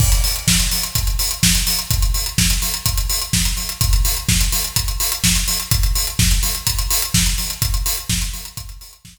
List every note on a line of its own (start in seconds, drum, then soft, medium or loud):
0.00 kick medium
0.00 crash medium
0.12 closed hi-hat medium
0.24 open hi-hat medium
0.36 closed hi-hat medium
0.48 kick medium
0.48 snare loud
0.60 closed hi-hat medium
0.71 open hi-hat medium
0.83 closed hi-hat medium
0.95 kick medium
0.95 closed hi-hat medium
1.07 closed hi-hat medium
1.19 open hi-hat medium
1.31 closed hi-hat medium
1.43 kick medium
1.43 snare loud
1.55 closed hi-hat medium
1.67 open hi-hat medium
1.79 closed hi-hat medium
1.90 kick medium
1.90 closed hi-hat medium
2.02 closed hi-hat medium
2.14 open hi-hat medium
2.26 closed hi-hat medium
2.38 kick medium
2.38 snare medium
2.50 closed hi-hat medium
2.62 open hi-hat medium
2.74 closed hi-hat medium
2.86 kick medium
2.86 closed hi-hat medium
2.98 closed hi-hat medium
3.10 open hi-hat medium
3.22 closed hi-hat medium
3.33 kick medium
3.33 snare medium
3.45 closed hi-hat medium
3.57 open hi-hat medium
3.69 closed hi-hat medium
3.81 kick medium
3.81 closed hi-hat loud
3.93 closed hi-hat medium
4.05 open hi-hat medium
4.17 closed hi-hat medium
4.29 kick medium
4.29 snare medium
4.41 closed hi-hat medium
4.52 open hi-hat medium
4.64 closed hi-hat medium
4.76 kick medium
4.76 closed hi-hat medium
4.88 closed hi-hat medium
5.00 open hi-hat medium
5.12 closed hi-hat medium
5.24 kick medium
5.24 snare medium
5.36 closed hi-hat medium
5.48 open hi-hat medium
5.60 closed hi-hat medium
5.71 kick medium
5.71 closed hi-hat medium
5.83 closed hi-hat medium
5.95 open hi-hat medium
6.07 closed hi-hat medium
6.19 kick medium
6.19 snare medium
6.31 closed hi-hat medium
6.43 open hi-hat medium
6.55 closed hi-hat medium
6.67 kick medium
6.67 closed hi-hat loud
6.79 closed hi-hat medium
6.90 open hi-hat medium
7.02 closed hi-hat medium
7.14 kick medium
7.14 snare medium
7.26 closed hi-hat medium
7.38 open hi-hat medium
7.50 closed hi-hat medium
7.62 kick medium
7.62 closed hi-hat medium
7.74 closed hi-hat medium
7.86 open hi-hat medium
7.97 closed hi-hat medium
8.09 kick medium
8.09 snare medium
8.22 closed hi-hat medium
8.34 open hi-hat medium
8.45 closed hi-hat medium
8.57 kick medium
8.57 closed hi-hat medium
8.69 closed hi-hat medium
8.81 open hi-hat medium
8.93 closed hi-hat medium
9.05 kick medium
9.05 snare medium
9.17 closed hi-hat medium